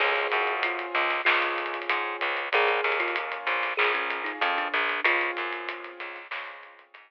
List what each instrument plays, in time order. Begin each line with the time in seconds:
0.00 electric bass (finger) C#2, acoustic grand piano C4 C#4 F4 G#4, kalimba G#4, kick, crash
0.16 closed hi-hat
0.32 electric bass (finger) F#2, closed hi-hat
0.47 closed hi-hat
0.63 kalimba F4, closed hi-hat
0.79 closed hi-hat
0.95 electric bass (finger) C#2, closed hi-hat
1.10 snare, closed hi-hat
1.25 electric bass (finger) C#2, acoustic grand piano C4 C#4 F4 G#4, kalimba F4, snare
1.42 closed hi-hat
1.58 closed hi-hat
1.66 closed hi-hat
1.74 closed hi-hat
1.82 closed hi-hat
1.89 electric bass (finger) G#2, closed hi-hat
2.21 electric bass (finger) C#2, closed hi-hat
2.37 closed hi-hat
2.52 electric bass (finger) A#1, acoustic grand piano A#3 C#4 F4 G#4, kalimba G#4, kick, closed hi-hat
2.68 kalimba G#4, closed hi-hat
2.84 electric bass (finger) D#2, closed hi-hat
2.92 closed hi-hat
3.00 kalimba F4, closed hi-hat
3.08 closed hi-hat
3.16 closed hi-hat
3.32 closed hi-hat
3.47 electric bass (finger) A#1, closed hi-hat
3.63 snare, closed hi-hat
3.77 electric bass (finger) A#1, acoustic grand piano A#3 C#4 F4 G#4, kalimba G#4, clap
3.94 kalimba C#4, snare, closed hi-hat
4.10 closed hi-hat
4.24 kalimba D#4, closed hi-hat
4.41 electric bass (finger) F2, kalimba C#4, closed hi-hat
4.58 kalimba D4, closed hi-hat
4.74 electric bass (finger) A#1, closed hi-hat
4.89 closed hi-hat
5.04 electric bass (finger) C#2, acoustic grand piano C4 C#4 F4 G#4, kalimba F4, kick, closed hi-hat
5.21 closed hi-hat
5.37 electric bass (finger) F#2, closed hi-hat
5.53 closed hi-hat
5.69 closed hi-hat
5.84 snare, closed hi-hat
6.00 electric bass (finger) C#2, closed hi-hat
6.16 snare, closed hi-hat
6.31 electric bass (finger) C#2, acoustic grand piano C4 C#4 F4 G#4, snare
6.47 closed hi-hat
6.63 closed hi-hat
6.79 closed hi-hat
6.94 electric bass (finger) G#2, closed hi-hat